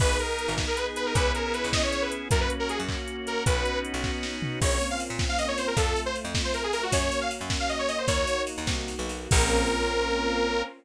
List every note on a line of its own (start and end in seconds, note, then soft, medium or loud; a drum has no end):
0.00 0.18 G#1 medium
0.00 1.14 B3 medium
0.00 1.13 B3 medium
0.00 1.14 D#4 medium
0.00 1.13 D#4 medium
0.00 1.14 G#4 medium
0.00 1.13 G#4 medium
0.00 0.17 B4 loud
0.00 kick loud
0.00 crash medium
0.19 0.54 A#4 medium
0.19 closed hi-hat medium
0.39 closed hi-hat medium
0.48 0.66 G#1 medium
0.58 kick medium
0.58 snare medium
0.67 0.77 A#4 medium
0.77 0.86 B4 medium
0.77 closed hi-hat medium
0.96 1.05 B4 medium
0.96 closed hi-hat medium
1.06 1.15 A#4 medium
1.15 1.32 C#2 medium
1.15 2.28 B3 medium
1.15 2.30 B3 medium
1.15 2.28 C#4 medium
1.15 2.30 C#4 medium
1.15 2.28 E4 medium
1.15 2.30 E4 medium
1.15 2.28 G#4 medium
1.15 2.30 G#4 medium
1.15 1.32 B4 loud
1.15 kick loud
1.15 closed hi-hat medium
1.35 1.44 A#4 medium
1.35 closed hi-hat medium
1.44 1.53 A#4 medium
1.54 1.69 B4 medium
1.54 closed hi-hat medium
1.64 1.82 C#2 medium
1.73 1.82 D#5 medium
1.73 kick medium
1.73 snare loud
1.83 1.92 C#5 medium
1.92 2.02 C#5 medium
1.92 closed hi-hat medium
2.02 2.11 B4 medium
2.12 closed hi-hat medium
2.31 2.48 F#2 medium
2.31 3.45 A#3 medium
2.31 3.44 A#3 medium
2.31 3.45 C#4 medium
2.31 3.44 C#4 medium
2.31 3.45 F#4 medium
2.31 3.44 F#4 medium
2.31 2.40 A#4 loud
2.31 kick loud
2.31 closed hi-hat loud
2.41 2.50 B4 medium
2.50 closed hi-hat medium
2.60 2.69 A#4 medium
2.69 2.78 G#4 medium
2.69 closed hi-hat medium
2.79 2.97 F#2 medium
2.88 kick medium
2.88 clap medium
3.08 closed hi-hat medium
3.27 3.43 A#4 medium
3.27 closed hi-hat medium
3.46 3.64 B1 medium
3.46 4.60 B3 medium
3.46 4.60 C#4 medium
3.46 4.60 D#4 medium
3.46 4.60 F#4 medium
3.46 3.79 B4 medium
3.46 kick loud
3.46 closed hi-hat loud
3.65 closed hi-hat medium
3.85 closed hi-hat medium
3.94 4.11 B1 medium
4.04 kick medium
4.04 snare medium
4.23 snare medium
4.42 floor tom medium
4.61 4.79 A#1 medium
4.61 5.76 A#3 medium
4.61 5.76 C4 medium
4.61 5.76 C#4 medium
4.61 5.76 F4 medium
4.61 4.87 C#5 medium
4.61 kick medium
4.61 crash loud
4.81 ride medium
4.90 5.00 F5 medium
5.00 ride medium
5.10 5.27 A#2 medium
5.19 kick medium
5.19 snare medium
5.29 5.38 F5 medium
5.38 5.48 D#5 medium
5.38 ride medium
5.48 5.57 C#5 medium
5.58 5.67 C5 medium
5.58 ride medium
5.67 5.76 A#4 medium
5.77 5.94 F2 medium
5.77 6.91 A3 medium
5.77 6.91 C4 medium
5.77 6.91 F4 medium
5.77 6.00 A4 medium
5.77 kick medium
5.77 ride medium
5.96 ride medium
6.06 6.15 C5 medium
6.15 ride medium
6.25 6.42 F2 medium
6.35 kick medium
6.35 snare loud
6.44 6.53 C5 medium
6.54 6.63 A#4 medium
6.54 ride medium
6.64 6.73 G#4 medium
6.73 6.82 A#4 loud
6.73 ride medium
6.83 6.92 F#4 medium
6.92 7.10 F#2 medium
6.92 8.06 A#3 medium
6.92 8.06 C#4 medium
6.92 8.06 F#4 medium
6.92 7.19 C#5 medium
6.92 kick medium
6.92 ride loud
7.12 ride medium
7.21 7.30 F5 medium
7.31 ride medium
7.41 7.58 F#2 medium
7.50 kick medium
7.50 snare medium
7.60 7.69 F5 medium
7.69 7.78 D#5 medium
7.69 ride medium
7.79 7.88 C#5 medium
7.88 7.98 D#5 medium
7.88 ride medium
7.98 8.07 C5 medium
8.08 8.25 D#2 medium
8.08 9.30 A#3 medium
8.08 9.30 D#4 medium
8.08 9.30 F#4 medium
8.08 8.42 C#5 loud
8.08 kick medium
8.08 ride medium
8.27 ride medium
8.47 ride medium
8.58 8.67 D#2 medium
8.67 8.95 C2 medium
8.67 kick medium
8.67 snare medium
8.88 ride medium
8.99 9.28 B1 medium
9.09 ride medium
9.31 10.63 A#1 loud
9.31 10.62 A#3 loud
9.31 10.62 C4 loud
9.31 10.62 C#4 loud
9.31 10.62 F4 medium
9.31 10.62 A#4 loud
9.31 kick loud
9.31 crash loud